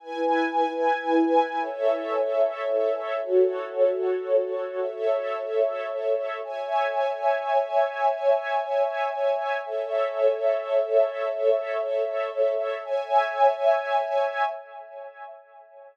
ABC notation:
X:1
M:3/4
L:1/8
Q:1/4=112
K:E
V:1 name="String Ensemble 1"
[EBg]6 | [Ace]6 | [FAc]6 | [Ace]6 |
[K:C#m] [ceg]6- | [ceg]6 | [Ace]6- | [Ace]6 |
[ceg]6 |]